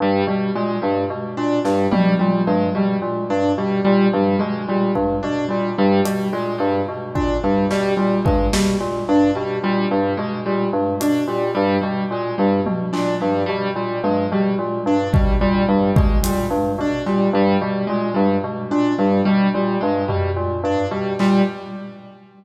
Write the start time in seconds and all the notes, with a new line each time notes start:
0.00 G2 G3
0.27 B2 G3
0.55 A#2 G#3
0.82 G2 G3
1.10 B2
1.37 A#2 D4
1.65 G2 G3, snare
1.92 B2 G3, high tom
2.19 A#2 G3
2.47 G2 G#3
2.75 B2 G3
3.02 A#2
3.30 G2 D4
3.58 B2 G3
3.85 A#2 G3
4.13 G2 G3, high tom
4.39 B2 G#3
4.68 A#2 G3
4.95 G2, kick
5.23 B2 D4
5.49 A#2 G3
5.78 G2 G3
6.05 B2 G3, closed hi-hat
6.33 A#2 G#3
6.58 G2 G3
6.89 B2
7.15 A#2 D4, kick
7.44 G2 G3
7.71 B2 G3, snare
7.97 A#2 G3
8.25 G2 G#3, kick
8.53 B2 G3, snare
8.81 A#2
9.09 G2 D4
9.35 B2 G3
9.63 A#2 G3
9.91 G2 G3
10.17 B2 G#3
10.46 A#2 G3
10.73 G2
11.00 B2 D4, closed hi-hat
11.28 A#2 G3
11.55 G2 G3
11.81 B2 G3
12.11 A#2 G#3
12.38 G2 G3
12.66 B2, high tom
12.93 A#2 D4, clap
13.21 G2 G3
13.46 B2 G3
13.76 A#2 G3
14.04 G2 G#3, high tom
14.32 B2 G3
14.59 A#2
14.86 G2 D4
15.13 B2 G3, kick
15.41 A#2 G3
15.68 G2 G3
15.96 B2 G#3, kick
16.23 A#2 G3, closed hi-hat
16.51 G2
16.79 B2 D4
17.06 A#2 G3, cowbell
17.33 G2 G3
17.62 B2 G3
17.87 A#2 G#3
18.14 G2 G3
18.44 B2
18.71 A#2 D4
18.98 G2 G3
19.25 B2 G3
19.54 A#2 G3
19.81 G2 G#3
20.08 B2 G3, floor tom
20.36 A#2
20.64 G2 D4
20.91 B2 G3
21.19 A#2 G3, clap